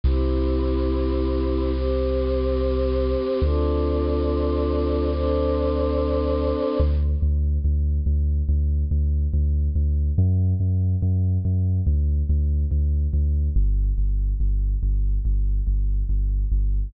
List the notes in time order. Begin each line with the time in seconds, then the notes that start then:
0.04 C2 C4 E4 G4
1.73 C4 G4 C5
3.42 D2 C4 D4 F4 A4
5.11 C4 D4 A4 C5
6.80 D2
7.22 D2
7.64 D2
8.06 D2
8.49 D2
8.91 D2
9.33 D2
9.75 D2
10.18 F#2
10.60 F#2
11.02 F#2
11.45 F#2
11.87 D2
12.29 D2
12.71 D2
13.13 D2
13.56 G1
13.98 G1
14.40 G1
14.83 G1
15.25 G1
15.67 G1
16.09 G1
16.52 G1